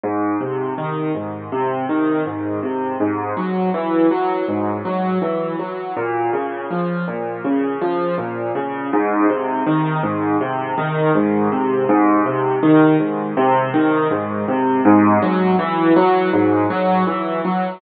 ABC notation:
X:1
M:4/4
L:1/8
Q:1/4=81
K:Ab
V:1 name="Acoustic Grand Piano" clef=bass
A,, C, E, A,, C, E, A,, C, | A,, _G, _F, G, A,, G, F, G, | B,, D, F, B,, D, F, B,, D, | A,, C, E, A,, C, E, A,, C, |
A,, C, E, A,, C, E, A,, C, | A,, _G, _F, G, A,, G, F, G, |]